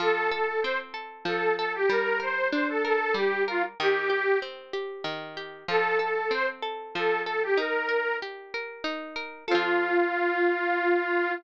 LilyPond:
<<
  \new Staff \with { instrumentName = "Accordion" } { \time 3/4 \key f \mixolydian \tempo 4 = 95 a'8 a'8 c''16 r8. a'8 a'16 g'16 | bes'8 c''8 c''16 a'16 a'8 g'8 f'16 r16 | g'4 r2 | a'8 a'8 c''16 r8. a'8 a'16 g'16 |
bes'4 r2 | f'2. | }
  \new Staff \with { instrumentName = "Pizzicato Strings" } { \time 3/4 \key f \mixolydian f8 a'8 c'8 a'8 f8 a'8 | g8 bes'8 d'8 bes'8 g8 bes'8 | ees8 g'8 c'8 g'8 ees8 g'8 | f8 a'8 c'8 a'8 f8 a'8 |
ees'8 bes'8 g'8 bes'8 ees'8 bes'8 | <f c' a'>2. | }
>>